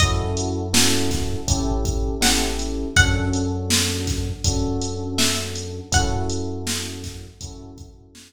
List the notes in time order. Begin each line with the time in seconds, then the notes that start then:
0.00 F#2 C#4 E4 F#4 A4 D#5, kick, closed hi-hat
0.37 closed hi-hat
0.73 C#4 E4 F#4 A4, snare
1.11 kick, snare, closed hi-hat
1.48 A1 C#4 E4 G4 A4, kick, closed hi-hat
1.85 kick, closed hi-hat
2.21 C#4 E4 G4 A4 F#5, snare
2.59 closed hi-hat
2.96 F#2 C#4 D4 F#4 A4 F#5, kick, closed hi-hat
3.33 closed hi-hat
3.70 snare
4.07 kick, snare, closed hi-hat
4.44 F#2 C#4 D4 F#4 A4, kick, closed hi-hat
4.81 closed hi-hat
5.18 E5, snare
5.56 closed hi-hat
5.92 F#2 C#4 E4 F#4 A4 F#5, kick, closed hi-hat
6.30 closed hi-hat
6.67 snare
7.04 kick, snare, closed hi-hat
7.41 F#2 C#4 E4 F#4 A4, kick, closed hi-hat
7.78 kick, closed hi-hat
8.15 snare